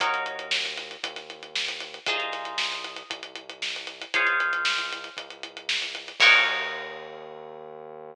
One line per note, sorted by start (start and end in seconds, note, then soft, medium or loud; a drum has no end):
0.00 0.96 D#2 medium
0.00 2.03 D#4 medium
0.00 2.03 F#4 medium
0.00 2.03 A#4 medium
0.00 2.03 C#5 medium
0.00 kick loud
0.00 closed hi-hat loud
0.14 closed hi-hat medium
0.26 closed hi-hat medium
0.39 closed hi-hat medium
0.51 snare loud
0.63 snare soft
0.63 closed hi-hat medium
0.77 snare soft
0.77 closed hi-hat medium
0.91 closed hi-hat medium
1.04 1.99 D#2 medium
1.04 kick medium
1.04 closed hi-hat loud
1.16 snare soft
1.16 closed hi-hat medium
1.30 closed hi-hat medium
1.43 closed hi-hat medium
1.55 snare medium
1.68 closed hi-hat medium
1.80 closed hi-hat medium
1.94 closed hi-hat medium
2.06 3.03 C2 medium
2.06 4.10 D#4 medium
2.06 4.10 F4 medium
2.06 4.10 G#4 medium
2.06 4.10 C5 medium
2.06 kick loud
2.06 closed hi-hat medium
2.20 closed hi-hat medium
2.32 snare soft
2.32 closed hi-hat medium
2.45 closed hi-hat medium
2.58 snare medium
2.72 closed hi-hat medium
2.84 closed hi-hat medium
2.96 closed hi-hat medium
3.10 4.05 C2 medium
3.10 kick medium
3.10 closed hi-hat medium
3.23 closed hi-hat medium
3.36 closed hi-hat medium
3.50 closed hi-hat medium
3.62 snare medium
3.76 closed hi-hat medium
3.87 closed hi-hat medium
4.02 closed hi-hat medium
4.14 5.09 C#2 medium
4.14 6.17 F4 medium
4.14 6.17 G#4 medium
4.14 6.17 C5 medium
4.14 6.17 C#5 medium
4.14 kick medium
4.14 closed hi-hat loud
4.27 closed hi-hat medium
4.40 closed hi-hat medium
4.53 closed hi-hat medium
4.65 snare loud
4.78 closed hi-hat medium
4.93 closed hi-hat medium
5.04 closed hi-hat medium
5.17 6.12 C#2 medium
5.17 kick medium
5.17 closed hi-hat medium
5.30 closed hi-hat medium
5.43 closed hi-hat medium
5.57 closed hi-hat medium
5.69 snare loud
5.82 closed hi-hat medium
5.95 closed hi-hat medium
6.08 snare soft
6.08 closed hi-hat medium
6.20 8.14 D#2 loud
6.20 8.13 D#4 loud
6.20 8.13 F#4 loud
6.20 8.13 A#4 medium
6.20 8.13 C#5 loud
6.20 kick loud
6.20 crash loud